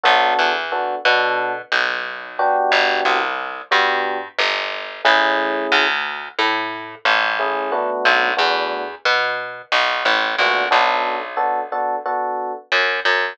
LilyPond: <<
  \new Staff \with { instrumentName = "Electric Piano 1" } { \time 4/4 \key b \minor \tempo 4 = 90 <b d' fis' a'>4 <b d' fis' a'>8 <b d' fis' a'>2 <b d' fis' g'>8~ | <b d' fis' g'>4. <b d' fis' g'>2 <a cis' e' gis'>8~ | <a cis' e' gis'>2. <a cis' e' gis'>8 <a b d' fis'>8~ | <a b d' fis'>8 <a b d' fis'>2. <a b d' fis'>8 |
<b d' fis' a'>4 <b d' fis' a'>8 <b d' fis' a'>8 <b d' fis' a'>2 | }
  \new Staff \with { instrumentName = "Electric Bass (finger)" } { \clef bass \time 4/4 \key b \minor b,,8 e,4 b,4 b,,4. | g,,8 c,4 g,4 g,,4 a,,8~ | a,,8 d,4 a,4 a,,4. | b,,8 e,4 b,4 b,,8 a,,8 ais,,8 |
b,,2. fis,8 fis,8 | }
>>